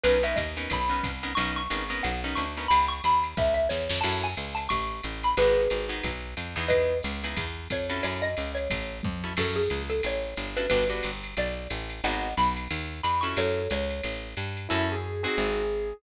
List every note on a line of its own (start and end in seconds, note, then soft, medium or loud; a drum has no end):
0.04 0.35 B1 medium
0.04 0.18 B3 medium
0.04 0.18 C#4 medium
0.04 0.18 D#4 medium
0.04 0.18 A#4 medium
0.04 0.22 B4 medium
0.04 ride medium
0.23 0.45 B3 medium
0.23 0.45 C#4 medium
0.23 0.45 D#4 medium
0.23 0.45 A#4 medium
0.23 0.37 E5 medium
0.36 0.68 D#2 medium
0.36 0.65 D#5 soft
0.36 kick soft
0.36 hi-hat pedal medium
0.36 ride medium
0.57 0.79 B3 medium
0.57 0.79 C#4 medium
0.57 0.79 D#4 medium
0.57 0.79 A#4 medium
0.57 ride soft
0.70 1.02 B1 medium
0.70 1.31 B5 medium
0.70 kick soft
0.70 ride medium
0.89 1.11 B3 medium
0.89 1.11 C#4 medium
0.89 1.11 D#4 medium
0.89 1.11 A#4 medium
1.03 1.35 C2 medium
1.03 kick soft
1.03 hi-hat pedal medium
1.03 ride medium
1.23 1.33 B3 medium
1.23 1.33 C#4 medium
1.23 1.33 D#4 medium
1.23 1.33 A#4 medium
1.23 ride medium
1.35 1.68 B1 medium
1.35 1.62 B3 medium
1.35 1.62 C#4 medium
1.35 1.62 D#4 medium
1.35 1.62 A#4 medium
1.35 1.52 C#6 medium
1.35 ride medium
1.56 1.97 C#6 medium
1.70 2.02 G#1 medium
1.70 1.84 B3 medium
1.70 1.84 C#4 medium
1.70 1.84 D#4 medium
1.70 1.84 A#4 medium
1.70 hi-hat pedal medium
1.70 ride medium
1.89 2.12 B3 medium
1.89 2.12 C#4 medium
1.89 2.12 D#4 medium
1.89 2.12 A#4 medium
1.89 ride soft
2.03 2.35 B1 medium
2.03 2.20 F#5 medium
2.03 ride medium
2.24 2.46 B3 medium
2.24 2.46 C#4 medium
2.24 2.46 D#4 medium
2.24 2.46 A#4 medium
2.35 2.68 D2 medium
2.35 2.67 C#6 medium
2.35 hi-hat pedal medium
2.35 ride medium
2.57 2.67 B3 medium
2.57 2.67 C#4 medium
2.57 2.67 D#4 medium
2.57 2.67 A#4 medium
2.57 ride soft
2.68 3.01 C#2 medium
2.68 2.85 B5 medium
2.68 ride medium
2.88 3.01 C#6 medium
3.04 3.35 D#2 medium
3.04 3.36 B5 medium
3.04 hi-hat pedal medium
3.04 ride medium
3.24 ride medium
3.37 3.68 C#2 medium
3.37 3.54 E5 medium
3.37 kick medium
3.37 snare medium
3.54 3.67 E5 medium
3.69 3.88 E2 medium
3.69 3.98 C#5 medium
3.69 snare medium
3.89 4.03 F2 medium
3.89 snare medium
4.01 4.35 F#2 medium
4.01 4.29 C#4 medium
4.01 4.29 E4 medium
4.01 4.29 F#4 medium
4.01 4.29 A4 medium
4.01 4.17 A5 medium
4.01 crash medium
4.01 ride medium
4.24 4.55 G#5 medium
4.37 4.68 C#2 medium
4.37 hi-hat pedal medium
4.37 ride medium
4.55 4.67 A5 medium
4.55 ride medium
4.69 5.01 A1 medium
4.69 5.12 C#6 medium
4.69 kick soft
4.69 ride medium
5.04 5.35 A1 medium
5.04 hi-hat pedal medium
5.04 ride medium
5.23 5.37 B5 medium
5.23 ride medium
5.37 5.68 G#1 medium
5.37 5.63 B3 medium
5.37 5.63 D#4 medium
5.37 5.63 F#4 medium
5.37 6.08 G#4 medium
5.37 5.63 G#4 medium
5.37 6.08 B4 medium
5.37 ride medium
5.70 6.02 G#1 medium
5.70 hi-hat pedal medium
5.70 ride medium
5.89 6.11 B3 medium
5.89 6.11 D#4 medium
5.89 6.11 F#4 medium
5.89 6.11 G#4 medium
5.89 ride medium
6.04 6.35 B1 medium
6.04 kick soft
6.04 ride medium
6.37 6.56 F2 medium
6.37 hi-hat pedal medium
6.37 ride medium
6.56 7.01 E2 medium
6.56 6.95 B3 medium
6.56 6.95 D#4 medium
6.56 6.95 E4 medium
6.56 6.95 G#4 medium
6.56 ride soft
6.68 6.98 B4 medium
6.68 6.98 D#5 medium
6.68 kick soft
6.68 ride medium
7.03 7.35 C#2 medium
7.03 hi-hat pedal medium
7.03 ride medium
7.24 7.45 B3 medium
7.24 7.45 D#4 medium
7.24 7.45 E4 medium
7.24 7.45 G#4 medium
7.24 ride medium
7.37 7.68 E2 medium
7.37 kick soft
7.37 ride medium
7.70 8.01 F2 medium
7.70 8.03 C#5 medium
7.70 kick soft
7.70 hi-hat pedal medium
7.70 ride medium
7.90 8.29 C#4 medium
7.90 8.29 E4 medium
7.90 8.29 F#4 medium
7.90 8.29 A4 medium
7.90 ride medium
8.03 8.35 F#2 medium
8.03 8.21 C#5 medium
8.03 ride medium
8.22 8.51 D#5 medium
8.37 8.68 C#2 medium
8.37 hi-hat pedal medium
8.37 ride medium
8.55 8.98 C#5 medium
8.55 ride soft
8.70 9.01 A1 medium
8.70 kick soft
8.70 ride medium
9.03 9.35 F2 medium
9.03 kick medium
9.03 high tom medium
9.24 9.33 C#4 medium
9.24 9.33 E4 medium
9.24 9.33 F#4 medium
9.24 9.33 A4 medium
9.37 9.68 F#2 medium
9.37 9.62 C#4 medium
9.37 9.62 E4 medium
9.37 9.62 F#4 medium
9.37 9.62 A4 medium
9.37 9.56 A4 medium
9.37 kick soft
9.37 crash medium
9.37 ride medium
9.56 9.82 G#4 medium
9.70 10.01 C#2 medium
9.70 hi-hat pedal medium
9.70 ride medium
9.90 10.01 A4 medium
9.90 ride medium
10.03 10.35 A1 medium
10.03 10.51 C#5 medium
10.03 ride medium
10.37 10.68 G1 medium
10.37 hi-hat pedal medium
10.37 ride medium
10.57 10.66 C#4 medium
10.57 10.66 E4 medium
10.57 10.66 F#4 medium
10.57 10.66 A4 medium
10.57 10.68 B4 medium
10.57 ride medium
10.70 11.01 G1 medium
10.70 10.85 B3 medium
10.70 10.85 D4 medium
10.70 10.85 F#4 medium
10.70 10.85 G4 medium
10.70 10.87 B4 medium
10.70 kick soft
10.70 ride medium
10.89 11.11 B3 medium
10.89 11.11 D4 medium
10.89 11.11 F#4 medium
10.89 11.11 G4 medium
11.03 11.35 G1 medium
11.03 hi-hat pedal medium
11.03 ride medium
11.24 ride medium
11.37 11.68 B1 medium
11.37 11.68 D5 medium
11.37 ride medium
11.70 12.01 A1 medium
11.70 hi-hat pedal medium
11.70 ride medium
11.90 ride medium
12.04 12.34 G#1 medium
12.04 12.29 B3 medium
12.04 12.29 D#4 medium
12.04 12.29 F#4 medium
12.04 12.29 G#4 medium
12.04 12.34 D#5 medium
12.04 12.34 F#5 medium
12.04 ride medium
12.37 12.68 B1 medium
12.37 12.54 B5 medium
12.37 hi-hat pedal medium
12.37 ride medium
12.57 ride medium
12.71 13.01 D#2 medium
12.71 ride medium
13.03 13.35 F2 medium
13.03 13.22 B5 medium
13.03 hi-hat pedal medium
13.03 ride medium
13.21 13.62 C#4 medium
13.21 13.62 E4 medium
13.21 13.62 F#4 medium
13.21 13.62 A4 medium
13.21 13.34 C#6 soft
13.21 ride medium
13.37 13.68 F#2 medium
13.37 13.70 A4 medium
13.37 13.70 C#5 medium
13.37 ride medium
13.70 14.01 C#2 medium
13.70 14.28 C#5 medium
13.70 hi-hat pedal medium
13.70 ride medium
13.90 ride soft
14.04 14.35 A1 medium
14.04 ride medium
14.37 14.68 G2 medium
14.37 hi-hat pedal medium
14.37 ride medium
14.57 ride soft
14.69 15.27 F#2 medium
14.69 14.95 C#4 loud
14.69 14.85 E4 medium
14.69 14.95 E4 loud
14.69 14.95 F#4 loud
14.69 14.95 A4 loud
14.92 15.21 G#4 medium
15.23 15.63 C4 medium
15.23 15.63 D#4 loud
15.23 15.63 F#4 loud
15.23 15.93 G#4 medium
15.23 15.63 G#4 loud
15.38 15.93 G#1 medium